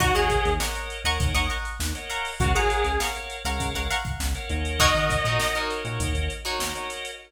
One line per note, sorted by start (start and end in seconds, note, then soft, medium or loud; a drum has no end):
0.00 0.13 D#2 medium
0.00 0.14 F#4 loud
0.00 0.12 A#4 medium
0.00 0.12 C#5 loud
0.00 0.12 D#5 loud
0.00 0.12 F#5 loud
0.00 0.12 A#5 loud
0.00 0.12 C#6 loud
0.00 kick loud
0.00 closed hi-hat loud
0.15 0.29 D#2 medium
0.15 0.52 G#4 loud
0.15 0.51 A#4 medium
0.15 0.51 C#5 loud
0.15 0.51 D#5 loud
0.15 0.51 F#5 medium
0.15 0.51 F#5 loud
0.15 0.51 A#5 loud
0.15 0.51 C#6 loud
0.15 closed hi-hat medium
0.30 kick medium
0.30 closed hi-hat medium
0.45 0.59 D#2 medium
0.45 closed hi-hat medium
0.60 0.72 A#4 medium
0.60 0.72 C#5 medium
0.60 0.72 D#5 medium
0.60 0.96 D#5 loud
0.60 0.72 F#5 medium
0.60 0.96 F#5 loud
0.60 0.96 A#5 loud
0.60 0.96 C#6 loud
0.60 snare loud
0.75 0.99 A#4 medium
0.75 0.99 C#5 medium
0.75 0.99 D#5 medium
0.75 0.99 F#5 medium
0.75 snare soft
0.75 closed hi-hat medium
0.90 closed hi-hat medium
1.04 1.18 D#2 medium
1.04 1.53 A#4 medium
1.04 1.53 C#5 medium
1.04 1.29 D#5 medium
1.04 1.53 D#5 medium
1.04 1.53 F#5 medium
1.04 1.29 F#5 medium
1.04 1.29 A#5 medium
1.04 1.29 C#6 loud
1.04 closed hi-hat medium
1.20 1.34 D#2 medium
1.20 kick loud
1.20 closed hi-hat loud
1.34 1.48 D#2 medium
1.34 1.47 D#5 loud
1.34 1.47 F#5 loud
1.34 1.47 A#5 medium
1.34 1.47 C#6 medium
1.34 closed hi-hat medium
1.50 1.98 D#5 medium
1.50 1.98 F#5 loud
1.50 1.98 A#5 medium
1.50 1.98 C#6 loud
1.50 closed hi-hat medium
1.65 closed hi-hat medium
1.79 1.93 D#2 medium
1.79 snare loud
1.95 2.31 A#4 medium
1.95 2.31 C#5 medium
1.95 2.31 D#5 medium
1.95 2.31 F#5 medium
1.95 closed hi-hat medium
2.10 2.52 F5 loud
2.10 2.52 F#5 loud
2.10 2.52 A#5 loud
2.10 2.52 C#6 loud
2.10 closed hi-hat medium
2.25 open hi-hat medium
2.40 2.53 C#2 medium
2.40 2.54 F#4 loud
2.40 2.52 A#4 loud
2.40 2.52 C#5 loud
2.40 2.52 F5 loud
2.40 2.52 F#5 loud
2.40 kick loud
2.40 closed hi-hat loud
2.54 2.68 C#3 medium
2.54 2.98 G#4 loud
2.54 2.91 A#4 medium
2.54 2.91 C#5 medium
2.54 2.91 F5 medium
2.54 2.92 F5 medium
2.54 2.91 F#5 medium
2.54 2.92 F#5 loud
2.54 2.92 A#5 medium
2.54 2.92 C#6 medium
2.54 closed hi-hat medium
2.70 closed hi-hat medium
2.84 2.98 C#2 medium
2.84 closed hi-hat medium
3.00 3.12 A#4 medium
3.00 3.12 C#5 medium
3.00 3.12 F5 medium
3.00 3.36 F5 loud
3.00 3.12 F#5 medium
3.00 3.36 F#5 medium
3.00 3.36 A#5 medium
3.00 3.36 C#6 loud
3.00 snare loud
3.15 3.39 A#4 medium
3.15 3.39 C#5 medium
3.15 3.39 F5 medium
3.15 3.39 F#5 medium
3.15 closed hi-hat medium
3.30 closed hi-hat medium
3.45 3.58 C#2 medium
3.45 3.93 A#4 medium
3.45 3.93 C#5 medium
3.45 3.93 F5 medium
3.45 3.69 F5 loud
3.45 3.93 F#5 loud
3.45 3.69 F#5 loud
3.45 3.69 A#5 loud
3.45 3.69 C#6 medium
3.45 snare soft
3.45 closed hi-hat medium
3.59 3.73 C#2 medium
3.59 kick medium
3.59 closed hi-hat loud
3.75 3.88 C#2 medium
3.75 3.87 F5 medium
3.75 3.87 F#5 medium
3.75 3.87 A#5 loud
3.75 3.87 C#6 medium
3.75 closed hi-hat medium
3.91 4.38 F5 medium
3.91 4.38 F#5 loud
3.91 4.38 A#5 medium
3.91 4.38 C#6 medium
3.91 closed hi-hat medium
4.05 kick medium
4.05 closed hi-hat medium
4.20 4.33 C#2 medium
4.20 snare loud
4.35 4.49 A#4 medium
4.35 4.49 C#5 medium
4.35 4.49 F5 medium
4.35 4.49 F#5 loud
4.35 closed hi-hat medium
4.50 4.93 D#2 medium
4.50 4.92 A#4 loud
4.50 4.92 C#5 loud
4.50 4.92 D#5 loud
4.50 4.92 F#5 loud
4.50 closed hi-hat medium
4.65 closed hi-hat medium
4.79 5.16 D#4 loud
4.79 5.16 F#4 loud
4.79 5.16 A#4 loud
4.79 5.16 C#5 loud
4.79 5.58 D#5 loud
4.79 kick medium
4.79 closed hi-hat loud
4.95 5.08 D#3 medium
4.95 5.07 A#4 medium
4.95 5.07 C#5 medium
4.95 5.07 D#5 medium
4.95 5.07 F#5 medium
4.95 closed hi-hat medium
5.10 5.58 A#4 medium
5.10 5.58 C#5 medium
5.10 5.58 D#5 medium
5.10 5.58 F#5 loud
5.10 kick medium
5.10 snare soft
5.10 closed hi-hat medium
5.25 5.38 A#2 medium
5.25 5.49 D#4 medium
5.25 5.49 F#4 medium
5.25 5.49 A#4 medium
5.25 5.49 C#5 medium
5.25 closed hi-hat medium
5.40 snare loud
5.55 6.03 D#4 medium
5.55 6.03 F#4 medium
5.55 6.03 A#4 medium
5.55 6.03 C#5 loud
5.55 closed hi-hat medium
5.70 5.82 A#4 medium
5.70 5.82 C#5 medium
5.70 5.82 D#5 medium
5.70 5.82 F#5 medium
5.70 snare soft
5.70 closed hi-hat medium
5.85 5.98 A#2 medium
5.85 6.33 A#4 medium
5.85 6.33 C#5 loud
5.85 6.33 D#5 medium
5.85 6.33 F#5 medium
5.85 closed hi-hat medium
6.00 6.13 D#2 medium
6.00 kick medium
6.00 closed hi-hat loud
6.15 6.28 D#2 medium
6.15 closed hi-hat medium
6.30 closed hi-hat medium
6.45 6.93 D#4 medium
6.45 6.93 F#4 loud
6.45 6.93 A#4 medium
6.45 6.93 C#5 loud
6.45 closed hi-hat medium
6.59 6.73 D#2 medium
6.59 6.72 A#4 medium
6.59 6.72 C#5 medium
6.59 6.72 D#5 medium
6.59 6.72 F#5 loud
6.59 snare loud
6.75 7.11 A#4 medium
6.75 7.11 C#5 medium
6.75 7.11 D#5 medium
6.75 7.11 F#5 medium
6.75 closed hi-hat medium
6.90 snare soft
6.90 closed hi-hat medium
7.05 closed hi-hat medium